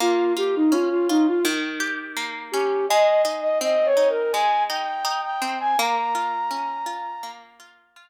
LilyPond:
<<
  \new Staff \with { instrumentName = "Flute" } { \time 4/4 \key bes \dorian \tempo 4 = 83 f'8 g'16 ees'16 f'16 f'16 ees'16 f'16 r4. g'8 | ees''8 r16 ees''16 \tuplet 3/2 { ees''8 des''8 bes'8 } aes''8 g''8. g''8 aes''16 | bes''2~ bes''8 r4. | }
  \new Staff \with { instrumentName = "Pizzicato Strings" } { \time 4/4 \key bes \dorian bes8 f'8 des'8 f'8 ees8 g'8 bes8 des'8 | aes8 ees'8 c'8 ees'8 aes8 ees'8 ees'8 c'8 | bes8 f'8 des'8 f'8 bes8 f'8 f'8 r8 | }
>>